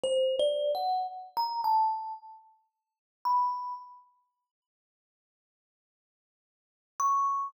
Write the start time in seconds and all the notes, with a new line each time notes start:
0.04 C5
0.40 D5
0.75 F#5
1.37 A#5
1.64 A5
3.25 B5
7.00 C#6